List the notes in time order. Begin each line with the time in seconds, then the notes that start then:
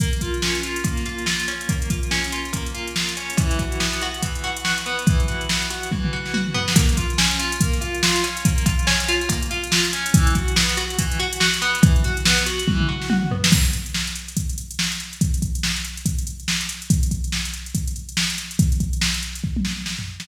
0.00 A#3, kick, closed hi-hat
0.13 closed hi-hat
0.21 F4, kick, closed hi-hat
0.34 closed hi-hat
0.42 C#4, snare
0.55 closed hi-hat
0.63 F4, closed hi-hat
0.76 closed hi-hat
0.84 A#3, kick, closed hi-hat
0.97 snare, closed hi-hat
1.06 F4, closed hi-hat
1.18 closed hi-hat
1.26 F4, snare
1.40 closed hi-hat
1.48 C#4, snare, closed hi-hat
1.61 closed hi-hat
1.69 A#3, kick, closed hi-hat
1.82 closed hi-hat
1.90 F4, kick, closed hi-hat
2.03 closed hi-hat
2.11 C#4, snare
2.24 closed hi-hat
2.32 F4, closed hi-hat
2.45 closed hi-hat
2.53 A#3, kick, closed hi-hat
2.66 closed hi-hat
2.74 F4, closed hi-hat
2.87 closed hi-hat
2.96 F4, snare
3.09 closed hi-hat
3.17 C#4, closed hi-hat
3.30 closed hi-hat
3.37 E3, kick, closed hi-hat
3.51 closed hi-hat
3.59 F#4, kick, closed hi-hat
3.72 closed hi-hat
3.80 B3, snare
3.93 closed hi-hat
4.01 F#4, closed hi-hat
4.14 closed hi-hat
4.23 E3, kick, closed hi-hat
4.35 closed hi-hat
4.44 F#4, closed hi-hat
4.57 closed hi-hat
4.65 F#4, snare
4.78 closed hi-hat
4.86 B3, closed hi-hat
4.99 closed hi-hat
5.06 E3, kick, closed hi-hat
5.20 closed hi-hat
5.28 F#4, closed hi-hat
5.41 closed hi-hat
5.49 B3, snare
5.62 closed hi-hat
5.70 F#4, closed hi-hat
5.83 closed hi-hat
5.92 E3, kick, high tom
6.04 mid tom
6.13 F#4
6.26 snare
6.34 F#4, high tom
6.47 mid tom
6.54 B3, floor tom
6.68 snare
6.76 A#3, kick, closed hi-hat
6.89 closed hi-hat
6.97 F4, kick, closed hi-hat
7.10 closed hi-hat
7.18 C#4, snare
7.31 closed hi-hat
7.39 F4, closed hi-hat
7.52 closed hi-hat
7.61 A#3, kick, closed hi-hat
7.73 snare, closed hi-hat
7.81 F4, closed hi-hat
7.95 closed hi-hat
8.03 F4, snare
8.16 closed hi-hat
8.23 C#4, snare, closed hi-hat
8.37 closed hi-hat
8.45 A#3, kick, closed hi-hat
8.58 closed hi-hat
8.66 F4, kick, closed hi-hat
8.79 closed hi-hat
8.87 C#4, snare
9.00 closed hi-hat
9.08 F4, closed hi-hat
9.21 closed hi-hat
9.29 A#3, kick, closed hi-hat
9.43 closed hi-hat
9.51 F4, closed hi-hat
9.64 closed hi-hat
9.72 F4, snare
9.85 closed hi-hat
9.93 C#4, closed hi-hat
10.06 closed hi-hat
10.14 E3, kick, closed hi-hat
10.27 closed hi-hat
10.35 F#4, kick, closed hi-hat
10.48 closed hi-hat
10.56 B3, snare
10.69 closed hi-hat
10.77 F#4, closed hi-hat
10.90 closed hi-hat
10.99 E3, kick, closed hi-hat
11.12 closed hi-hat
11.20 F#4, closed hi-hat
11.33 closed hi-hat
11.40 F#4, snare
11.54 closed hi-hat
11.62 B3, closed hi-hat
11.75 closed hi-hat
11.83 E3, kick, closed hi-hat
11.96 closed hi-hat
12.04 F#4, closed hi-hat
12.17 closed hi-hat
12.25 B3, snare
12.38 closed hi-hat
12.46 F#4, closed hi-hat
12.59 closed hi-hat
12.68 E3, kick, high tom
12.80 mid tom
12.89 F#4
13.02 snare
13.10 F#4, high tom
13.23 mid tom
13.31 B3, floor tom
13.44 snare
13.52 kick, crash
13.65 closed hi-hat
13.73 closed hi-hat
13.86 closed hi-hat
13.94 snare
14.07 closed hi-hat
14.15 closed hi-hat
14.28 closed hi-hat
14.37 kick, closed hi-hat
14.49 closed hi-hat
14.58 closed hi-hat
14.71 closed hi-hat
14.79 snare
14.92 closed hi-hat
15.00 closed hi-hat
15.13 closed hi-hat
15.21 kick, closed hi-hat
15.34 closed hi-hat
15.42 kick, closed hi-hat
15.55 closed hi-hat
15.63 snare
15.76 closed hi-hat
15.85 closed hi-hat
15.97 closed hi-hat
16.06 kick, closed hi-hat
16.18 closed hi-hat
16.27 closed hi-hat
16.40 closed hi-hat
16.48 snare
16.61 closed hi-hat
16.69 snare, closed hi-hat
16.82 closed hi-hat
16.90 kick, closed hi-hat
17.03 closed hi-hat
17.11 kick, closed hi-hat
17.24 closed hi-hat
17.32 snare
17.45 closed hi-hat
17.54 closed hi-hat
17.66 closed hi-hat
17.75 kick, closed hi-hat
17.87 closed hi-hat
17.96 closed hi-hat
18.09 closed hi-hat
18.17 snare
18.30 closed hi-hat
18.38 snare, closed hi-hat
18.51 closed hi-hat
18.59 kick, closed hi-hat
18.72 closed hi-hat
18.80 kick, closed hi-hat
18.93 closed hi-hat
19.01 snare
19.14 snare, closed hi-hat
19.23 closed hi-hat
19.35 closed hi-hat
19.44 kick
19.57 high tom
19.65 snare
19.86 snare
19.99 floor tom
20.20 snare